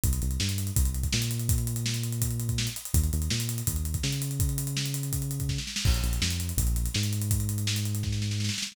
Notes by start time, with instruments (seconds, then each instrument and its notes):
0.04 synth bass 1 C2, kick, closed hi-hat
0.13 closed hi-hat
0.22 synth bass 1 C2, closed hi-hat
0.31 closed hi-hat
0.40 synth bass 1 G2, snare
0.49 closed hi-hat
0.58 closed hi-hat
0.67 closed hi-hat
0.76 synth bass 1 C2, kick, closed hi-hat
0.85 closed hi-hat
0.94 closed hi-hat
1.03 kick, closed hi-hat
1.12 synth bass 1 A#2, snare
1.22 closed hi-hat
1.31 closed hi-hat
1.39 closed hi-hat
1.49 kick, closed hi-hat
1.58 closed hi-hat
1.67 closed hi-hat
1.76 closed hi-hat
1.86 snare
1.94 closed hi-hat
2.03 closed hi-hat
2.12 closed hi-hat
2.22 kick, closed hi-hat
2.31 closed hi-hat
2.40 closed hi-hat
2.49 kick, closed hi-hat
2.58 snare
2.67 closed hi-hat
2.76 closed hi-hat
2.85 closed hi-hat
2.94 synth bass 1 D#2, kick, closed hi-hat
3.04 closed hi-hat
3.13 synth bass 1 D#2, closed hi-hat
3.22 closed hi-hat
3.30 synth bass 1 A#2, snare
3.40 closed hi-hat
3.49 closed hi-hat
3.58 closed hi-hat
3.67 synth bass 1 D#2, kick, closed hi-hat
3.76 closed hi-hat
3.85 closed hi-hat
3.94 kick, closed hi-hat
4.03 synth bass 1 C#3, snare
4.12 closed hi-hat
4.22 closed hi-hat
4.31 closed hi-hat
4.40 kick, closed hi-hat
4.49 closed hi-hat
4.58 closed hi-hat
4.67 closed hi-hat
4.77 snare
4.86 closed hi-hat
4.94 closed hi-hat
5.03 closed hi-hat
5.13 kick, closed hi-hat
5.22 closed hi-hat
5.31 closed hi-hat
5.40 kick, closed hi-hat
5.49 kick, snare
5.58 snare
5.67 snare
5.76 snare
5.85 synth bass 1 A#1, kick, crash
5.94 closed hi-hat
6.03 synth bass 1 A#1, closed hi-hat
6.13 closed hi-hat
6.21 synth bass 1 F2, snare
6.31 closed hi-hat
6.40 closed hi-hat
6.49 closed hi-hat
6.57 synth bass 1 A#1, kick, closed hi-hat
6.67 closed hi-hat
6.76 closed hi-hat
6.86 closed hi-hat
6.94 synth bass 1 G#2, snare
7.03 closed hi-hat
7.13 closed hi-hat
7.22 closed hi-hat
7.31 kick, closed hi-hat
7.40 closed hi-hat
7.49 closed hi-hat
7.58 closed hi-hat
7.67 snare
7.76 closed hi-hat
7.85 closed hi-hat
7.95 closed hi-hat
8.03 kick, snare
8.12 snare
8.22 snare
8.31 snare
8.40 snare
8.44 snare
8.49 snare
8.54 snare
8.58 snare
8.62 snare
8.67 snare
8.72 snare